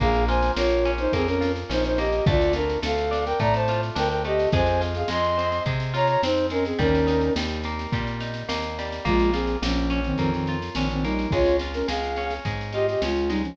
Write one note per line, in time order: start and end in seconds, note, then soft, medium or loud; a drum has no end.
0.00 0.51 A#1 medium
0.00 0.57 A#3 medium
0.00 0.25 G#4 medium
0.00 0.25 F5 loud
0.00 kick medium
0.00 snare medium
0.14 snare medium
0.28 1.40 F4 medium
0.28 0.52 C5 medium
0.28 0.52 G#5 medium
0.28 snare medium
0.42 snare medium
0.56 1.08 A#1 medium
0.56 1.13 A#3 medium
0.56 0.91 F4 medium
0.56 0.91 C#5 medium
0.56 snare loud
0.70 snare medium
0.85 1.69 C#4 medium
0.85 snare medium
0.98 1.12 D#4 medium
0.98 1.12 C5 medium
0.98 snare medium
1.13 1.64 F2 medium
1.13 1.98 A#3 medium
1.13 1.28 C4 medium
1.13 1.28 G#4 medium
1.13 kick medium
1.13 snare medium
1.26 1.52 C#4 medium
1.26 1.52 A#4 medium
1.26 snare medium
1.41 2.21 F4 medium
1.41 snare medium
1.56 snare medium
1.69 2.21 A#1 medium
1.69 2.23 C#4 medium
1.69 1.84 D#4 medium
1.69 1.84 C5 medium
1.69 snare medium
1.84 1.98 D#4 medium
1.84 1.98 C5 medium
1.84 snare medium
1.98 2.25 A#3 medium
1.98 2.25 G4 medium
1.98 2.25 D#5 medium
1.98 snare medium
2.12 snare medium
2.26 2.77 D2 loud
2.26 2.82 A3 medium
2.26 2.53 F4 medium
2.26 2.53 D5 medium
2.26 kick loud
2.26 snare medium
2.41 snare medium
2.53 2.79 D4 medium
2.53 3.68 F4 medium
2.53 2.79 A#4 medium
2.53 snare medium
2.69 snare medium
2.82 3.34 D2 medium
2.82 3.39 A3 medium
2.82 3.25 A4 medium
2.82 3.25 F5 medium
2.82 snare loud
2.98 snare medium
3.11 3.95 D4 medium
3.11 snare medium
3.26 3.39 A#4 medium
3.26 3.39 G5 medium
3.26 snare medium
3.40 3.91 A2 medium
3.40 4.24 A3 medium
3.40 3.54 D5 medium
3.40 3.54 A#5 medium
3.40 kick medium
3.40 snare medium
3.54 3.81 C5 medium
3.54 3.81 A5 medium
3.54 snare medium
3.68 4.49 F4 medium
3.68 snare medium
3.83 snare medium
3.95 4.47 D2 medium
3.95 4.49 D4 medium
3.95 4.08 A#4 medium
3.95 4.08 G5 medium
3.95 snare medium
4.09 4.22 A#4 medium
4.09 4.22 G5 medium
4.09 snare medium
4.24 4.52 A3 medium
4.24 4.49 G4 medium
4.24 4.49 D#5 medium
4.24 snare medium
4.39 snare medium
4.52 5.04 F2 loud
4.52 5.08 G#3 medium
4.52 4.81 C5 medium
4.52 4.81 G#5 medium
4.52 kick medium
4.52 snare medium
4.66 snare medium
4.81 5.93 F4 medium
4.81 snare medium
4.95 5.09 G#4 medium
4.95 5.09 F5 medium
4.95 snare medium
5.08 5.60 F2 medium
5.08 5.65 G#3 medium
5.08 5.63 D#5 medium
5.08 5.63 C6 medium
5.08 snare medium
5.24 snare medium
5.37 6.23 C4 medium
5.37 snare medium
5.52 snare medium
5.66 6.17 C3 medium
5.66 6.51 G#3 medium
5.66 kick medium
5.66 snare medium
5.80 snare medium
5.94 6.74 F4 medium
5.94 6.07 C#5 medium
5.94 6.07 A#5 medium
5.94 snare medium
6.07 6.21 C#5 medium
6.07 6.21 A#5 medium
6.07 snare medium
6.23 6.74 F2 medium
6.23 6.77 C4 medium
6.23 6.46 D#4 medium
6.23 6.46 C5 medium
6.23 snare loud
6.37 snare medium
6.50 6.78 G#3 medium
6.50 6.65 C#4 medium
6.50 6.65 A#4 medium
6.50 snare medium
6.65 6.79 C4 medium
6.65 6.79 G#4 medium
6.65 snare medium
6.79 7.30 D#2 loud
6.79 7.37 G3 medium
6.79 7.33 C#4 medium
6.79 7.33 A#4 medium
6.79 kick medium
6.79 snare medium
6.95 snare medium
7.07 8.20 D#4 medium
7.07 snare medium
7.21 snare medium
7.36 7.87 D#2 medium
7.36 7.93 G3 medium
7.36 snare loud
7.49 snare medium
7.64 8.48 A#3 medium
7.64 snare medium
7.79 snare medium
7.92 8.43 A#2 medium
7.92 8.78 G3 medium
7.92 kick medium
7.92 snare medium
8.07 snare medium
8.20 9.01 D#4 medium
8.20 snare medium
8.34 snare medium
8.49 9.00 D#2 medium
8.49 9.02 A#3 medium
8.49 snare loud
8.62 snare medium
8.79 9.06 G3 medium
8.79 snare medium
8.92 snare medium
9.05 9.57 A#1 medium
9.05 9.30 G#3 medium
9.05 9.62 A#3 medium
9.05 9.30 F4 medium
9.05 kick medium
9.05 snare medium
9.19 snare medium
9.33 9.57 C4 medium
9.33 10.48 F4 medium
9.33 9.57 G#4 medium
9.33 snare medium
9.47 snare medium
9.62 10.13 A#1 medium
9.62 10.01 F3 medium
9.62 10.18 A#3 medium
9.62 10.01 C#4 medium
9.62 snare loud
9.77 snare soft
9.90 10.75 C#4 medium
9.90 snare medium
10.04 10.18 D#3 medium
10.04 10.18 C4 medium
10.04 snare medium
10.18 10.70 F2 medium
10.18 10.31 D#3 medium
10.18 11.04 A#3 medium
10.18 10.31 C4 medium
10.18 kick medium
10.18 snare medium
10.31 10.57 D#3 medium
10.31 10.57 C4 medium
10.31 snare medium
10.47 11.29 F4 medium
10.47 snare medium
10.62 snare medium
10.75 11.26 A#1 medium
10.75 10.88 D#3 medium
10.75 10.88 C4 medium
10.75 11.30 C#4 medium
10.75 snare medium
10.89 11.04 D#3 medium
10.89 11.04 C4 medium
10.89 snare medium
11.03 11.27 G3 medium
11.03 11.31 A#3 medium
11.03 11.27 D#4 medium
11.03 snare medium
11.19 snare medium
11.31 11.83 C#2 medium
11.31 11.87 G#3 medium
11.31 11.56 F4 medium
11.31 11.56 C#5 medium
11.31 kick medium
11.31 snare medium
11.45 snare medium
11.59 12.74 F4 medium
11.59 snare medium
11.73 11.87 C#4 medium
11.73 11.87 A#4 medium
11.73 snare medium
11.88 12.40 C#2 medium
11.88 12.45 G#3 medium
11.88 12.34 G#4 medium
11.88 12.34 F5 medium
11.88 snare medium
12.04 snare medium
12.16 13.03 C#4 medium
12.16 snare medium
12.30 snare medium
12.45 12.96 G#2 medium
12.45 13.29 G#3 medium
12.45 kick medium
12.45 snare medium
12.61 snare medium
12.73 13.55 F4 medium
12.73 12.86 G4 medium
12.73 12.86 D#5 medium
12.73 snare medium
12.88 13.01 G4 medium
12.88 13.01 D#5 medium
12.88 snare medium
13.02 13.53 C#2 medium
13.02 13.30 G#3 medium
13.02 13.57 C#4 medium
13.02 13.30 F4 medium
13.02 snare medium
13.16 snare medium
13.28 13.42 G3 medium
13.28 13.56 G#3 medium
13.28 13.42 D#4 medium
13.28 snare medium
13.43 13.56 F3 medium
13.43 13.56 C#4 medium
13.43 snare medium